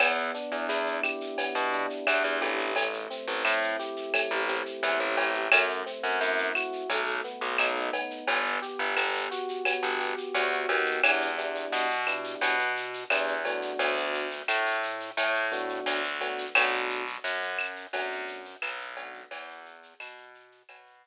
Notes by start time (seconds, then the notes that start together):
0.00 E2 B3, cowbell, claves, shaker
0.17 shaker
0.34 D4, shaker
0.52 E2, shaker
0.69 E2 E4, shaker
0.86 shaker
1.03 G4, claves, shaker
1.21 shaker
1.38 B3, cowbell, shaker
1.55 B2, shaker
1.72 D4, shaker
1.90 shaker
2.07 E2 E4, cowbell, claves, shaker
2.24 E2, shaker
2.41 A1 G4, cowbell, shaker
2.59 shaker
2.76 A3, cowbell, shaker
2.93 shaker
3.10 C4, shaker
3.27 A1, shaker
3.45 A2 E4, claves, shaker
3.62 shaker
3.79 G4, shaker
3.96 shaker
4.14 A3, cowbell, claves, shaker
4.31 A1, shaker
4.48 C4, shaker
4.66 shaker
4.83 E2 E4, cowbell, shaker
5.00 A1, shaker
5.17 A1 G4, cowbell, shaker
5.34 shaker
5.52 F#2 A3, cowbell, claves, shaker
5.69 shaker
5.86 C4, shaker
6.03 F#2, shaker
6.21 F#2 E4, shaker
6.38 shaker
6.55 F#4, claves, shaker
6.73 shaker
6.90 B1 A3, cowbell, shaker
7.07 shaker
7.24 B3, shaker
7.41 B1, shaker
7.58 B1 D#4, cowbell, claves, shaker
7.76 shaker
7.93 B3, cowbell, shaker
8.10 shaker
8.27 G1, cowbell, shaker
8.45 shaker
8.62 G4, shaker
8.79 G1, shaker
8.97 G1 B3, claves, shaker
9.14 shaker
9.31 F#4, shaker
9.48 shaker
9.65 B3, cowbell, claves, shaker
9.83 G1, shaker
10.00 G4, shaker
10.17 shaker
10.34 D2 F#4, cowbell, shaker
10.52 shaker
10.69 D#2 B3, cowbell, shaker
10.86 shaker
11.03 E2 B3 D4 E4 G4, cowbell, claves, shaker
11.21 shaker
11.38 B3 D4 E4 G4, shaker
11.55 shaker
11.72 B2, shaker
11.90 shaker
12.07 B3 D4 E4 G4, claves, shaker
12.24 shaker
12.41 B2, cowbell, shaker
12.59 shaker
12.76 shaker
12.93 shaker
13.10 E2 B3 D4 E4 G4, cowbell, claves, shaker
13.28 shaker
13.45 A3 B3 D4 F#4, cowbell, shaker
13.62 shaker
13.79 D2, cowbell, shaker
13.96 shaker
14.14 shaker
14.31 shaker
14.48 A2, claves, shaker
14.66 shaker
14.83 shaker
15.00 shaker
15.17 A2, cowbell, shaker
15.34 shaker
15.52 A3 B3 D4 F#4, shaker
15.69 shaker
15.86 D2, cowbell, shaker
16.03 shaker
16.21 A3 B3 D4 F#4, cowbell, shaker
16.38 shaker
16.55 B1 A3 B3 D4 F#4, cowbell, claves, shaker
16.72 shaker
16.90 shaker
17.07 shaker
17.24 F#2, shaker
17.41 shaker
17.59 claves, shaker
17.76 shaker
17.93 F#2 A3 B3 D4 F#4, cowbell, shaker
18.10 shaker
18.28 shaker
18.45 shaker
18.62 B1, cowbell, claves, shaker
18.79 shaker
18.97 A3 B3 D4 F#4, cowbell, shaker
19.14 shaker
19.31 E2, cowbell, shaker
19.48 shaker
19.66 shaker
19.83 shaker
20.00 B2, claves, shaker
20.17 shaker
20.34 shaker
20.52 shaker
20.69 B2, cowbell, claves, shaker
20.86 shaker
21.03 shaker